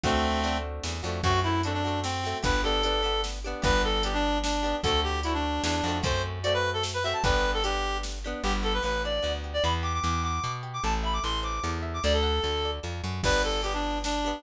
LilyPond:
<<
  \new Staff \with { instrumentName = "Clarinet" } { \time 3/4 \key g \major \tempo 4 = 150 <a c'>4. r4. | fis'8 e'8 d'16 d'8. c'4 | b'8 a'4. r4 | b'8 a'8 g'16 d'8. d'4 |
a'8 g'8 e'16 d'8. d'4 | c''8 r8 d''16 b'8 a'16 r16 b'16 e''16 a''16 | b'8. a'16 g'4 r4 | g'16 r16 a'16 b'16 b'8 d''8. r8 d''16 |
b''16 r16 d'''16 d'''16 d'''8 d'''8. r8 d'''16 | a''16 r16 b''16 d'''16 c'''8 d'''8. r8 d'''16 | d''16 a'4.~ a'16 r4 | b'8 a'8 g'16 d'8. d'4 | }
  \new Staff \with { instrumentName = "Acoustic Guitar (steel)" } { \time 3/4 \key g \major <a c' d' fis'>4 <a c' d' fis'>4. <a c' d' fis'>8 | <a c' fis'>8 <a c' fis'>8 <a c' fis'>8 <a c' fis'>4 <a c' fis'>8 | <b d' g'>8 <b d' g'>8 <b d' g'>8 <b d' g'>4 <b d' g'>8 | <b d' g'>4 <b d' g'>4. <b d' g'>8 |
<a c' d' fis'>4 <a c' d' fis'>4. <a c' d' fis'>8 | <a c' fis'>4 <a c' fis'>4. <a c' fis'>8 | <b d' g'>4 <b d' g'>4. <b d' g'>8 | b8 g'8 b8 d'8 b8 g'8 |
b8 g'8 b8 fis'8 b8 g'8 | a'8 e''8 a'8 c''8 a'8 e''8 | a'8 fis''8 a'8 d''8 a'8 fis''8 | <b d' g'>4 <b d' g'>4. <b d' g'>8 | }
  \new Staff \with { instrumentName = "Electric Bass (finger)" } { \clef bass \time 3/4 \key g \major d,2 e,8 f,8 | fis,2. | g,,2. | g,,2. |
d,2 e,8 f,8 | fis,2. | g,,2. | g,,4 a,,4 d,4 |
e,4 e,4 b,4 | a,,4 a,,4 e,4 | d,4 d,4 f,8 fis,8 | g,,2. | }
  \new DrumStaff \with { instrumentName = "Drums" } \drummode { \time 3/4 <hh bd>4 hh4 sn4 | <hh bd>4 hh4 sn4 | <hh bd>4 hh4 sn4 | <hh bd>4 hh4 sn4 |
<hh bd>4 hh4 sn4 | <hh bd>4 hh4 sn4 | <hh bd>4 hh4 sn4 | r4 r4 r4 |
r4 r4 r4 | r4 r4 r4 | r4 r4 r4 | <cymc bd>4 hh4 sn4 | }
>>